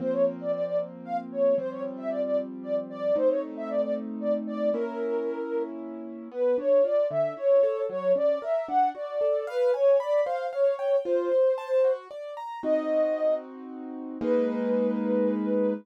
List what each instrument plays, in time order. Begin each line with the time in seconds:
0.00 acoustic grand piano F3 A#3 C4, ocarina C5
0.12 ocarina C#5
0.41 ocarina D5
0.52 ocarina D5
0.65 ocarina D5
1.05 ocarina F5
1.32 ocarina C#5
1.58 acoustic grand piano F3 G3 C4, ocarina C5
1.71 ocarina C#5
1.97 ocarina E5
2.09 ocarina D5
2.25 ocarina D5
2.63 ocarina D5
2.90 ocarina D5
3.16 acoustic grand piano A3 C4 D#4, ocarina C5
3.29 ocarina C#5
3.57 ocarina E5
3.70 ocarina D5
3.82 ocarina D5
4.21 ocarina D5
4.47 ocarina D5
4.74 acoustic grand piano A#3 C#4 E4, ocarina A#4
6.32 acoustic grand piano B3, ocarina B4
6.58 acoustic grand piano D4, ocarina C#5
6.84 acoustic grand piano F4, ocarina D5
7.10 acoustic grand piano D3, ocarina E5
7.37 acoustic grand piano E4, ocarina C#5
7.63 acoustic grand piano A4
7.89 acoustic grand piano F#3, ocarina C#5
8.16 acoustic grand piano C#4, ocarina D5
8.42 acoustic grand piano A#4, ocarina E5
8.68 acoustic grand piano D4, ocarina F#5
8.95 acoustic grand piano F#4, ocarina D5
9.21 acoustic grand piano A4
9.47 ocarina B4, acoustic grand piano F5
9.74 ocarina C#5, acoustic grand piano G#5
10.00 ocarina D5, acoustic grand piano B5
10.25 acoustic grand piano C5, ocarina F5
10.53 ocarina C#5, acoustic grand piano F5
10.79 acoustic grand piano G5
11.05 acoustic grand piano F4, ocarina C5
11.32 acoustic grand piano C5
11.58 acoustic grand piano A5
11.84 acoustic grand piano F#4
12.11 acoustic grand piano D5
12.37 acoustic grand piano A#5
12.63 acoustic grand piano C4 D#4 F#4, ocarina D#5
14.21 acoustic grand piano G#3 A#3 D#4, ocarina B4